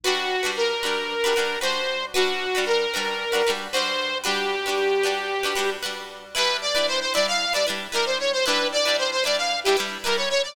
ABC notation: X:1
M:4/4
L:1/16
Q:1/4=114
K:Gmix
V:1 name="Lead 2 (sawtooth)"
^F4 ^A8 c4 | ^F4 ^A8 c4 | G12 z4 | B2 d2 c c d f2 d z2 ^A c _d c |
B2 d2 c c d f2 G z2 ^A ^c c d |]
V:2 name="Pizzicato Strings"
[G,D^FB]3 [G,DFB]3 [G,DFB]3 [G,DFB] [G,DFB]2 [G,DFB]4 | [G,D^FB]3 [G,DFB]3 [G,DFB]3 [G,DFB] [G,DFB]2 [G,DFB]4 | [G,D^FB]3 [G,DFB]3 [G,DFB]3 [G,DFB] [G,DFB]2 [G,DFB]4 | [G,DEB]3 [G,DEB]3 [G,DEB]3 [G,DEB] [G,DEB]2 [G,DEB]4 |
[G,DEB]3 [G,DEB]3 [G,DEB]3 [G,DEB] [G,DEB]2 [G,DEB]4 |]